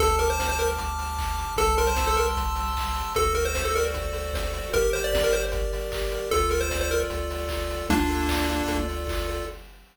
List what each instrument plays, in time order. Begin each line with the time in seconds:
0.00 synth bass 1 D2, lead 1 (square) A4 A5, kick, closed hi-hat
0.19 lead 1 (square) A#4 D6, open hi-hat
0.30 lead 1 (square) C5
0.39 lead 1 (square) F6, kick, snare
0.49 lead 1 (square) C5
0.59 lead 1 (square) A#4 A5, open hi-hat
0.78 lead 1 (square) D6, kick, closed hi-hat
0.98 lead 1 (square) F6, open hi-hat
1.18 lead 1 (square) A5, kick, clap
1.38 lead 1 (square) D6, open hi-hat
1.56 synth bass 1 C2, lead 1 (square) A4 A5, kick, closed hi-hat
1.77 lead 1 (square) A#4 C6, open hi-hat
1.87 lead 1 (square) C5
1.96 lead 1 (square) E6, kick, snare
2.07 lead 1 (square) A4
2.17 lead 1 (square) A#4 A5, open hi-hat
2.37 lead 1 (square) C6, kick, closed hi-hat
2.55 lead 1 (square) E6, open hi-hat
2.76 lead 1 (square) A5, kick, clap
2.96 lead 1 (square) C6, open hi-hat
3.15 synth bass 1 D2, lead 1 (square) F#4 A4, kick, closed hi-hat
3.34 lead 1 (square) A4 A#4, open hi-hat
3.45 lead 1 (square) C5
3.55 lead 1 (square) C5, kick, snare
3.65 lead 1 (square) A4
3.75 lead 1 (square) A#4 D5, open hi-hat
3.94 lead 1 (square) F#4, kick, closed hi-hat
4.13 lead 1 (square) A4, open hi-hat
4.33 lead 1 (square) C5, kick, snare
4.54 lead 1 (square) D5, open hi-hat
4.73 synth bass 1 G1, lead 1 (square) G4 A#4, kick, closed hi-hat
4.93 lead 1 (square) A#4 C5, open hi-hat
5.04 lead 1 (square) D5
5.13 lead 1 (square) D5, kick, snare
5.24 lead 1 (square) A#4
5.31 lead 1 (square) G4 C5, open hi-hat
5.52 lead 1 (square) A#4, kick, closed hi-hat
5.72 lead 1 (square) D5, open hi-hat
5.92 lead 1 (square) G4, kick, clap
6.11 lead 1 (square) A#4, open hi-hat
6.31 synth bass 1 D2, lead 1 (square) F4 A4, kick, closed hi-hat
6.49 lead 1 (square) A4 A#4, open hi-hat
6.61 lead 1 (square) C5
6.71 lead 1 (square) D5, kick, snare
6.81 lead 1 (square) C5
6.91 lead 1 (square) F4 A#4, open hi-hat
7.10 synth bass 1 D2, lead 1 (square) A4, kick, closed hi-hat
7.30 lead 1 (square) D5, open hi-hat
7.49 lead 1 (square) F4, kick, clap
7.70 lead 1 (square) A4, open hi-hat
7.89 synth bass 1 D2, lead 1 (square) A#3 D4 F4, kick, closed hi-hat
8.09 lead 1 (square) A4, open hi-hat
8.29 lead 1 (square) D5, kick, clap
8.49 lead 1 (square) F4, open hi-hat
8.68 synth bass 1 D2, lead 1 (square) A4, kick, closed hi-hat
8.88 lead 1 (square) D5, open hi-hat
9.07 lead 1 (square) F4, kick, clap
9.28 lead 1 (square) A4, open hi-hat